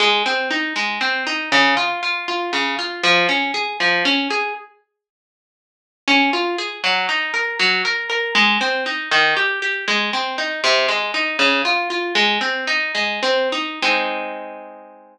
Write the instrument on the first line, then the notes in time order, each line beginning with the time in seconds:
orchestral harp
0.00 G#3
0.26 C4
0.51 D#4
0.76 G#3
1.01 C4
1.27 D#4
1.52 C#3
1.77 F4
2.03 F4
2.28 F4
2.53 C#3
2.79 F4
3.03 F3
3.29 C#4
3.54 G#4
3.80 F3
4.05 C#4
4.30 G#4
6.08 C#4
6.33 F4
6.58 G#4
6.84 F#3
7.09 D#4
7.34 A#4
7.59 F#3
7.85 A#4
8.10 A#4
8.35 G#3
8.61 C4
8.86 D#4
9.11 D#3
9.37 G4
9.62 G4
9.88 G#3
10.13 C4
10.38 D#4
10.64 C3
10.88 G#3
11.14 D#4
11.39 C#3
11.65 F4
11.90 F4
12.15 G#3
12.41 C4
12.67 D#4
12.95 G#3
13.23 C4
13.52 D#4
13.82 G#3 C4 D#4